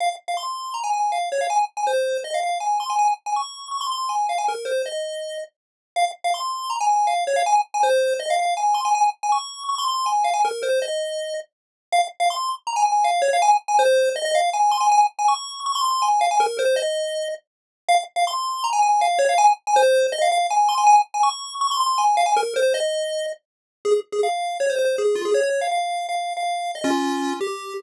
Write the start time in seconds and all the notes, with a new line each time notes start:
0.00 F5
0.28 F5
0.37 C6
0.74 A#5
0.84 G#5
0.93 G#5
1.12 F5
1.32 C#5
1.41 F5
1.50 G#5
1.77 G#5
1.87 C5
2.24 D#5
2.34 F5
2.43 F5
2.60 G#5
2.80 C6
2.90 G#5
2.99 G#5
3.26 G#5
3.36 C#6
3.71 C#6
3.81 C6
3.91 C6
4.09 G#5
4.29 F5
4.38 G#5
4.48 A#4
4.65 C5
4.86 D#5
5.96 F5
6.24 F5
6.34 C6
6.70 A#5
6.81 G#5
6.90 G#5
7.07 F5
7.27 C#5
7.36 F5
7.46 G#5
7.74 G#5
7.83 C5
8.19 D#5
8.30 F5
8.39 F5
8.57 G#5
8.74 C6
8.85 G#5
8.95 G#5
9.23 G#5
9.32 C#6
9.69 C#6
9.78 C6
9.88 C6
10.06 G#5
10.24 F5
10.34 G#5
10.45 A#4
10.63 C5
10.82 D#5
11.92 F5
12.20 F5
12.30 C6
12.67 A#5
12.76 G#5
12.86 G#5
13.04 F5
13.22 C#5
13.33 F5
13.42 G#5
13.68 G#5
13.79 C5
14.16 D#5
14.25 D#5
14.35 F5
14.53 G#5
14.71 C6
14.80 G#5
14.92 G#5
15.19 G#5
15.28 C#6
15.66 C#6
15.75 C6
15.85 C6
16.02 G#5
16.21 F5
16.31 G#5
16.40 A#4
16.59 C5
16.76 D#5
17.89 F5
18.16 F5
18.27 C6
18.64 A#5
18.73 G#5
18.83 G#5
19.01 F5
19.19 C#5
19.29 F5
19.38 G#5
19.67 G#5
19.76 C5
20.12 D#5
20.22 F5
20.32 F5
20.50 G#5
20.69 C6
20.78 G#5
20.87 G#5
21.14 G#5
21.23 C#6
21.61 C#6
21.71 C6
21.80 C6
21.98 G#5
22.17 F5
22.26 G#5
22.36 A#4
22.56 C5
22.74 D#5
23.85 G#4
24.12 G#4
24.23 F5
24.60 C#5
24.70 C5
24.79 C5
24.98 G#4
25.15 F4
25.25 G#4
25.34 C#5
25.43 C#5
25.61 F5
25.71 F5
26.09 F5
26.37 F5
26.75 D#5
26.84 C#4 F4
27.41 G4